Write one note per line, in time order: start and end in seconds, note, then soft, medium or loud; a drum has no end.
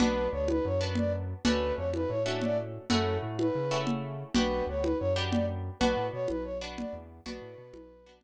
0.00 0.28 B1 loud
0.00 0.74 B3 medium
0.00 0.74 D4 medium
0.00 0.74 F#4 medium
0.00 0.27 B4 loud
0.00 low conga loud
0.32 0.60 D2 loud
0.32 0.47 C#5 medium
0.48 0.65 B4 loud
0.48 high conga medium
0.65 1.34 F#2 loud
0.65 0.80 C#5 medium
0.81 1.40 B3 medium
0.81 1.40 D4 medium
0.81 1.40 F#4 medium
0.95 1.12 D5 medium
0.95 low conga medium
1.44 1.72 D2 loud
1.44 2.19 A3 medium
1.44 2.19 C#4 medium
1.44 2.19 D4 medium
1.44 2.19 F#4 medium
1.44 1.73 B4 loud
1.44 low conga loud
1.77 2.05 F2 medium
1.77 1.90 C#5 medium
1.94 2.10 B4 medium
1.94 high conga medium
2.09 2.78 A2 medium
2.09 2.23 C#5 medium
2.26 2.85 A3 medium
2.26 2.85 C#4 medium
2.26 2.85 D4 medium
2.26 2.85 F#4 medium
2.41 2.58 D5 loud
2.41 low conga medium
2.90 3.18 F#2 loud
2.90 3.65 A3 medium
2.90 3.65 C#4 medium
2.90 3.65 E4 medium
2.90 3.65 F#4 medium
2.90 3.17 A4 loud
2.90 low conga loud
3.23 3.50 A2 loud
3.39 3.78 B4 medium
3.39 high conga medium
3.55 4.24 C#3 medium
3.71 4.30 A3 medium
3.71 4.30 C#4 medium
3.71 4.30 E4 medium
3.71 4.30 F#4 medium
3.87 low conga medium
4.34 4.62 B1 loud
4.34 5.10 B3 medium
4.34 5.10 D4 medium
4.34 5.10 F#4 medium
4.34 5.10 G4 medium
4.34 4.64 B4 loud
4.34 low conga loud
4.67 4.94 D2 loud
4.67 4.83 C#5 medium
4.83 4.98 B4 medium
4.83 high conga medium
4.99 5.70 F#2 medium
4.99 5.14 C#5 loud
5.16 5.75 B3 medium
5.16 5.75 D4 medium
5.16 5.75 F#4 medium
5.16 5.75 G4 medium
5.32 5.45 D5 medium
5.32 low conga medium
5.80 5.95 B1 loud
5.80 6.55 B3 medium
5.80 6.55 D4 medium
5.80 6.55 F#4 medium
5.80 6.07 B4 loud
5.80 low conga medium
5.97 6.10 A2 medium
6.13 6.27 B2 medium
6.13 6.28 C#5 loud
6.28 6.85 B1 medium
6.28 6.44 B4 medium
6.28 high conga medium
6.44 6.58 C#5 medium
6.61 7.21 B3 medium
6.61 7.21 D4 medium
6.61 7.21 F#4 medium
6.78 6.94 D5 medium
6.78 low conga medium
6.93 7.20 E2 loud
7.26 7.40 B1 loud
7.26 8.00 B3 loud
7.26 8.00 D4 medium
7.26 8.00 F#4 medium
7.26 8.13 B4 medium
7.26 low conga medium
7.42 7.55 A2 loud
7.58 7.72 B2 loud
7.73 8.24 B1 loud
7.73 high conga medium
8.06 8.24 B3 medium
8.06 8.24 D4 medium
8.06 8.24 F#4 medium
8.21 low conga medium